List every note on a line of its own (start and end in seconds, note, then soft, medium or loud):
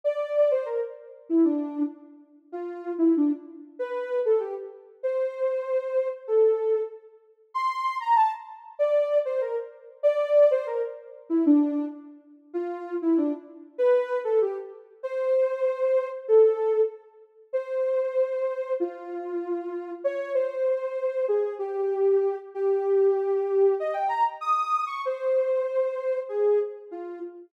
0.04 0.50 D5 medium
0.51 0.66 C5 medium
0.65 0.80 A#4 medium
1.29 1.44 E4 medium
1.44 1.83 D4 medium
2.52 2.93 F4 medium
2.98 3.13 E4 medium
3.17 3.32 D4 medium
3.79 4.19 B4 medium
4.25 4.40 A4 medium
4.40 4.55 G4 medium
5.03 6.08 C5 medium
6.27 6.80 A4 medium
7.54 7.96 C6 medium
8.00 8.15 A#5 medium
8.15 8.30 A5 medium
8.79 9.18 D5 loud
9.25 9.40 C5 medium
9.41 9.56 A#4 medium
10.03 10.49 D5 loud
10.51 10.66 C5 loud
10.67 10.82 A#4 medium
11.30 11.44 E4 medium
11.46 11.85 D4 loud
12.54 12.94 F4 loud
13.02 13.17 E4 medium
13.17 13.32 D4 loud
13.78 14.18 B4 loud
14.24 14.39 A4 medium
14.42 14.56 G4 medium
15.03 16.08 C5 loud
16.28 16.81 A4 medium
17.53 18.73 C5 medium
18.80 19.91 F4 medium
20.04 20.33 C#5 loud
20.34 21.25 C5 medium
21.28 21.54 G#4 medium
21.59 22.36 G4 medium
22.54 23.74 G4 medium
23.80 23.95 D#5 medium
23.94 24.08 G5 medium
24.08 24.23 A#5 medium
24.41 24.84 D#6 medium
24.87 25.01 C#6 medium
25.05 26.18 C5 medium
26.29 26.59 G#4 medium
26.91 27.19 F4 medium